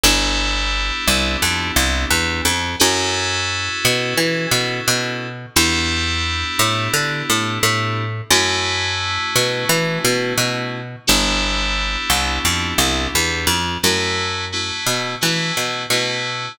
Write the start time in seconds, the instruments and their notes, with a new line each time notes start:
0.03 electric bass (finger) G1, electric piano 2 B3 D4 E4 G4
1.07 electric bass (finger) C2
1.42 electric bass (finger) F2
1.76 electric bass (finger) C2
2.10 electric bass (finger) E2
2.45 electric bass (finger) F2
2.79 electric bass (finger) F#2, electric piano 2 C#4 E4 F#4 A4
3.85 electric bass (finger) B2
4.17 electric bass (finger) E3
4.51 electric bass (finger) B2
4.87 electric bass (finger) B2
5.56 electric bass (finger) E2, electric piano 2 B3 D4 E4 G4
6.59 electric bass (finger) A2
6.94 electric bass (finger) D3
7.30 electric bass (finger) A2
7.63 electric bass (finger) A2
8.30 electric bass (finger) F#2, electric piano 2 A3 C#4 E4 F#4
9.35 electric bass (finger) B2
9.69 electric bass (finger) E3
10.04 electric bass (finger) B2
10.37 electric bass (finger) B2
11.07 electric bass (finger) G1, electric piano 2 B3 D4 E4 G4
12.10 electric bass (finger) C2
12.45 electric bass (finger) F2
12.78 electric bass (finger) C2
13.15 electric bass (finger) E2
13.47 electric bass (finger) F2
13.83 electric bass (finger) F#2, electric piano 2 A3 C#4 E4 F#4
14.52 electric piano 2 A3 C#4 E4 F#4
14.86 electric bass (finger) B2
15.21 electric bass (finger) E3, electric piano 2 A3 C#4 E4 F#4
15.57 electric bass (finger) B2
15.90 electric bass (finger) B2, electric piano 2 A3 C#4 E4 F#4